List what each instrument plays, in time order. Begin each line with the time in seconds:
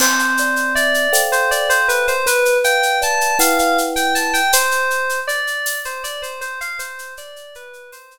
0.00 kalimba C4, electric piano 2 C5, crash
0.19 shaker
0.37 kalimba D5, shaker
0.56 shaker
0.75 electric piano 2 D5, kalimba E5, shaker
0.94 shaker
1.13 kalimba A4 C5 F5 G5, tambourine, shaker
1.32 electric piano 2 C5, shaker
1.51 electric piano 2 D5, shaker
1.69 electric piano 2 C5, shaker
1.88 electric piano 2 B4, shaker
2.08 electric piano 2 C5, shaker
2.26 kalimba B4, electric piano 2 B4, shaker
2.45 shaker
2.64 kalimba F5, electric piano 2 G5, shaker
2.83 shaker
3.02 kalimba D5, electric piano 2 A5, shaker
3.21 shaker
3.39 kalimba E4 B4 F#5 G5, electric piano 2 F5, tambourine, shaker
3.59 electric piano 2 F5, shaker
3.78 shaker
3.96 electric piano 2 G5, shaker
4.15 electric piano 2 A5, shaker
4.33 electric piano 2 G5, shaker
4.53 electric piano 2 C5, shaker
4.71 shaker
4.90 shaker
5.09 shaker
5.28 electric piano 2 D5, shaker
5.47 shaker
5.66 tambourine, shaker
5.85 electric piano 2 C5, shaker
6.04 electric piano 2 D5, shaker
6.22 electric piano 2 C5, shaker
6.41 electric piano 2 C5, shaker
6.61 electric piano 2 F5, shaker
6.79 electric piano 2 C5, shaker
6.99 shaker
7.17 electric piano 2 D5, shaker
7.36 shaker
7.55 electric piano 2 B4, shaker
7.73 shaker
7.92 electric piano 2 C5, tambourine, shaker
8.11 shaker